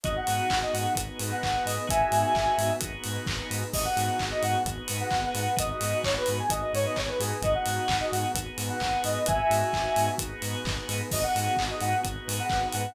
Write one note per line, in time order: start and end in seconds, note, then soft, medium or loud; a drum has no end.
0.03 0.17 G#1 medium
0.03 0.96 B3 medium
0.03 0.88 B3 medium
0.03 0.96 D#4 medium
0.03 0.88 D#4 medium
0.03 0.96 F#4 medium
0.03 0.88 F#4 medium
0.03 0.96 G#4 medium
0.03 0.88 G#4 medium
0.03 0.14 D#5 medium
0.03 kick loud
0.03 closed hi-hat medium
0.16 0.59 F#5 medium
0.27 0.40 G#2 medium
0.27 open hi-hat medium
0.50 0.63 G#1 medium
0.50 kick medium
0.50 clap loud
0.63 0.74 D#5 medium
0.73 0.86 G#2 medium
0.73 0.93 F#5 medium
0.73 open hi-hat medium
0.95 1.09 G#1 medium
0.95 1.78 B3 medium
0.95 1.88 B3 medium
0.95 1.78 D#4 medium
0.95 1.88 D#4 medium
0.95 1.78 F#4 medium
0.95 1.78 G#4 medium
0.95 1.88 G#4 medium
0.95 1.88 B4 medium
0.95 kick medium
0.95 closed hi-hat loud
1.19 1.32 G#2 medium
1.19 open hi-hat medium
1.31 1.64 F#5 medium
1.43 1.56 G#1 medium
1.43 kick medium
1.43 clap loud
1.65 1.78 G#2 medium
1.65 1.86 D#5 medium
1.65 open hi-hat medium
1.87 2.02 G#1 medium
1.87 2.70 B3 medium
1.87 2.81 B3 medium
1.87 2.70 D#4 medium
1.87 2.81 D#4 medium
1.87 2.70 F#4 medium
1.87 2.81 F#4 medium
1.87 2.70 G#4 medium
1.87 2.81 G#4 medium
1.87 2.73 E5 medium
1.87 2.73 G#5 medium
1.87 kick loud
1.87 closed hi-hat loud
2.12 2.24 G#2 medium
2.12 open hi-hat medium
2.35 2.47 G#1 medium
2.35 kick medium
2.35 clap loud
2.58 2.71 G#2 medium
2.58 open hi-hat medium
2.80 2.94 G#1 medium
2.80 3.64 B3 medium
2.80 3.73 B3 medium
2.80 3.64 D#4 medium
2.80 3.73 D#4 medium
2.80 3.64 F#4 medium
2.80 3.64 G#4 medium
2.80 3.73 G#4 medium
2.80 3.73 B4 medium
2.80 kick medium
2.80 closed hi-hat loud
3.04 3.18 G#2 medium
3.04 open hi-hat medium
3.26 3.40 G#1 medium
3.26 kick loud
3.26 clap loud
3.50 3.63 G#2 medium
3.50 open hi-hat medium
3.73 3.86 G#1 medium
3.73 4.57 B3 medium
3.73 4.65 B3 medium
3.73 4.57 D#4 medium
3.73 4.65 D#4 medium
3.73 4.57 F#4 medium
3.73 4.65 F#4 medium
3.73 4.57 G#4 medium
3.73 4.65 G#4 medium
3.73 3.84 D#5 medium
3.73 kick loud
3.73 crash loud
3.84 4.24 F#5 medium
3.97 4.09 G#2 medium
3.97 open hi-hat medium
4.19 4.33 G#1 medium
4.19 kick medium
4.19 clap loud
4.31 4.42 D#5 medium
4.43 4.55 G#2 medium
4.43 4.63 F#5 medium
4.43 open hi-hat medium
4.65 4.78 G#1 medium
4.65 5.57 B3 medium
4.65 5.50 B3 medium
4.65 5.57 D#4 medium
4.65 5.50 D#4 medium
4.65 5.50 F#4 medium
4.65 5.57 G#4 medium
4.65 5.50 G#4 medium
4.65 5.57 B4 medium
4.65 kick medium
4.65 closed hi-hat medium
4.88 5.02 G#2 medium
4.88 open hi-hat medium
5.00 5.29 F#5 medium
5.10 5.25 G#1 medium
5.10 kick loud
5.10 clap loud
5.35 5.47 G#2 medium
5.35 5.55 F#5 medium
5.35 open hi-hat medium
5.56 5.72 G#1 medium
5.56 6.39 B3 medium
5.56 6.49 B3 medium
5.56 6.39 D#4 medium
5.56 6.49 D#4 medium
5.56 6.39 F#4 medium
5.56 6.49 F#4 medium
5.56 6.39 G#4 medium
5.56 6.49 G#4 medium
5.56 5.70 D#5 medium
5.56 kick loud
5.56 closed hi-hat loud
5.70 5.98 D#5 medium
5.81 5.94 G#2 medium
5.81 open hi-hat medium
6.04 6.17 G#1 medium
6.04 6.15 C#5 medium
6.04 kick medium
6.04 clap loud
6.17 6.37 B4 medium
6.26 6.41 G#2 medium
6.26 open hi-hat medium
6.39 6.50 G#5 medium
6.50 6.62 G#1 medium
6.50 7.41 B3 medium
6.50 7.34 B3 medium
6.50 7.41 D#4 medium
6.50 7.34 D#4 medium
6.50 7.34 F#4 medium
6.50 7.41 G#4 medium
6.50 7.34 G#4 medium
6.50 7.41 B4 medium
6.50 6.61 D#5 medium
6.50 kick medium
6.50 closed hi-hat loud
6.62 6.73 D#5 medium
6.73 6.86 G#2 medium
6.73 6.85 C#5 medium
6.73 open hi-hat medium
6.86 6.97 D#5 medium
6.96 7.10 G#1 medium
6.96 7.08 C#5 medium
6.96 kick medium
6.96 clap loud
7.08 7.19 B4 medium
7.19 7.32 G#2 medium
7.19 7.41 G#4 medium
7.19 open hi-hat medium
7.42 7.55 G#1 medium
7.42 8.34 B3 medium
7.42 8.28 B3 medium
7.42 8.34 D#4 medium
7.42 8.28 D#4 medium
7.42 8.34 F#4 medium
7.42 8.28 F#4 medium
7.42 8.34 G#4 medium
7.42 8.28 G#4 medium
7.42 7.54 D#5 medium
7.42 kick loud
7.42 closed hi-hat medium
7.54 7.97 F#5 medium
7.66 7.79 G#2 medium
7.66 open hi-hat medium
7.88 8.02 G#1 medium
7.88 kick medium
7.88 clap loud
8.00 8.11 D#5 medium
8.11 8.25 G#2 medium
8.11 8.32 F#5 medium
8.11 open hi-hat medium
8.35 8.47 G#1 medium
8.35 9.26 B3 medium
8.35 9.19 B3 medium
8.35 9.26 D#4 medium
8.35 9.19 D#4 medium
8.35 9.19 F#4 medium
8.35 9.26 G#4 medium
8.35 9.19 G#4 medium
8.35 9.26 B4 medium
8.35 kick medium
8.35 closed hi-hat loud
8.58 8.70 G#2 medium
8.58 open hi-hat medium
8.69 9.02 F#5 medium
8.80 8.94 G#1 medium
8.80 kick medium
8.80 clap loud
9.04 9.17 G#2 medium
9.04 9.24 D#5 medium
9.04 open hi-hat medium
9.26 9.41 G#1 medium
9.26 10.09 B3 medium
9.26 10.18 B3 medium
9.26 10.09 D#4 medium
9.26 10.18 D#4 medium
9.26 10.09 F#4 medium
9.26 10.19 F#4 medium
9.26 10.09 G#4 medium
9.26 10.18 G#4 medium
9.26 10.11 E5 medium
9.26 10.11 G#5 medium
9.26 kick loud
9.26 closed hi-hat loud
9.50 9.63 G#2 medium
9.50 open hi-hat medium
9.73 9.86 G#1 medium
9.73 kick medium
9.73 clap loud
9.96 10.09 G#2 medium
9.96 open hi-hat medium
10.18 10.32 G#1 medium
10.18 11.02 B3 medium
10.18 11.10 B3 medium
10.18 11.02 D#4 medium
10.18 11.10 D#4 medium
10.18 11.02 F#4 medium
10.18 11.02 G#4 medium
10.18 11.10 G#4 medium
10.18 11.10 B4 medium
10.18 kick medium
10.18 closed hi-hat loud
10.42 10.55 G#2 medium
10.42 open hi-hat medium
10.65 10.78 G#1 medium
10.65 kick loud
10.65 clap loud
10.89 11.01 G#2 medium
10.89 open hi-hat medium
11.11 11.25 G#1 medium
11.11 11.95 B3 medium
11.11 12.04 B3 medium
11.11 11.95 D#4 medium
11.11 12.04 D#4 medium
11.11 11.95 F#4 medium
11.11 12.04 F#4 medium
11.11 11.95 G#4 medium
11.11 12.04 G#4 medium
11.11 11.23 D#5 medium
11.11 kick loud
11.11 crash loud
11.23 11.63 F#5 medium
11.35 11.48 G#2 medium
11.35 open hi-hat medium
11.57 11.71 G#1 medium
11.57 kick medium
11.57 clap loud
11.70 11.81 D#5 medium
11.81 11.94 G#2 medium
11.81 12.01 F#5 medium
11.81 open hi-hat medium
12.03 12.17 G#1 medium
12.03 12.86 B3 medium
12.03 12.95 B3 medium
12.03 12.86 D#4 medium
12.03 12.95 D#4 medium
12.03 12.86 F#4 medium
12.03 12.86 G#4 medium
12.03 12.95 G#4 medium
12.03 12.95 B4 medium
12.03 kick medium
12.03 closed hi-hat medium
12.27 12.40 G#2 medium
12.27 open hi-hat medium
12.39 12.68 F#5 medium
12.49 12.64 G#1 medium
12.49 kick loud
12.49 clap loud
12.72 12.87 G#2 medium
12.72 12.93 F#5 medium
12.72 open hi-hat medium